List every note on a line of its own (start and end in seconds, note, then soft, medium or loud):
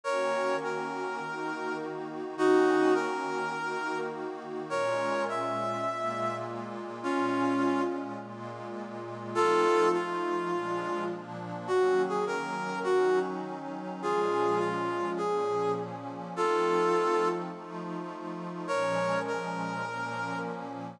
0.04 1.19 D#3 loud
0.04 1.19 A#3 loud
0.04 1.19 C#4 loud
0.04 1.19 F#4 loud
0.04 0.56 A#4 medium
0.04 0.56 C#5 medium
0.64 1.77 A#4 medium
1.19 2.35 D#3 loud
1.19 2.35 A#3 medium
1.19 2.35 D#4 loud
1.19 2.35 F#4 medium
2.36 3.52 D#3 loud
2.36 3.52 A#3 loud
2.36 3.52 C#4 loud
2.36 2.93 D#4 medium
2.36 3.52 F#4 loud
2.36 2.93 F#4 medium
2.94 3.98 A#4 medium
3.53 4.69 D#3 loud
3.53 4.69 A#3 loud
3.53 4.69 D#4 loud
3.53 4.69 F#4 medium
4.70 5.85 A#2 loud
4.70 5.85 G#3 loud
4.70 5.85 C#4 loud
4.70 5.85 F4 loud
4.70 5.24 A#4 medium
4.70 5.24 C#5 medium
5.29 6.35 E5 medium
5.86 7.02 A#2 loud
5.86 7.02 G#3 loud
5.86 7.02 A#3 loud
5.86 7.02 F4 loud
7.02 8.18 A#2 medium
7.02 8.18 G#3 loud
7.02 8.18 C#4 loud
7.02 7.82 C#4 medium
7.02 8.18 F4 loud
7.02 7.82 F4 medium
8.19 9.35 A#2 loud
8.19 9.35 G#3 loud
8.19 9.35 A#3 loud
8.19 9.35 F4 loud
9.35 9.94 F3 loud
9.35 9.94 A3 loud
9.35 9.94 C4 loud
9.35 9.94 D#4 loud
9.35 9.89 F4 medium
9.35 9.89 A4 loud
9.93 10.51 F3 loud
9.93 10.52 A3 loud
9.93 10.52 D#4 loud
9.93 11.04 F4 medium
9.93 10.52 F4 medium
10.52 11.10 A#2 loud
10.52 11.10 F3 loud
10.52 11.10 G#3 loud
10.52 11.10 D4 loud
11.11 11.69 A#2 loud
11.11 11.69 F3 loud
11.11 11.67 A#3 loud
11.11 11.69 D4 loud
11.67 12.83 D#3 loud
11.67 12.83 F#3 loud
11.67 12.83 A#3 medium
11.67 12.83 C#4 medium
11.67 12.02 F#4 medium
12.09 12.25 G#4 medium
12.27 12.79 A#4 medium
12.84 14.01 D#3 medium
12.84 14.01 F#3 loud
12.84 14.01 C#4 loud
12.84 14.01 D#4 loud
12.84 13.19 F#4 medium
14.02 15.17 A#2 medium
14.02 15.17 F3 medium
14.02 15.18 G#3 loud
14.02 15.17 C#4 loud
14.02 14.58 F4 medium
14.02 14.59 G#4 medium
14.59 15.10 F4 medium
15.17 16.34 A#2 loud
15.17 16.34 F3 medium
15.17 16.34 A#3 medium
15.17 16.34 C#4 loud
15.17 15.72 G#4 medium
16.35 17.50 F3 loud
16.35 17.50 A3 medium
16.35 17.50 C4 medium
16.35 17.50 D#4 medium
16.35 17.28 F4 medium
16.35 17.28 A4 medium
17.51 18.67 F3 loud
17.51 18.67 A3 loud
17.51 18.67 D#4 medium
17.51 18.67 F4 loud
18.67 19.84 A#2 loud
18.67 19.84 F3 loud
18.67 19.84 G#3 medium
18.67 19.84 C#4 loud
18.67 19.19 A#4 medium
18.67 19.19 C#5 medium
19.27 20.38 A#4 medium
19.85 21.00 A#2 loud
19.85 21.00 F3 loud
19.85 21.00 A#3 loud
19.85 21.00 C#4 loud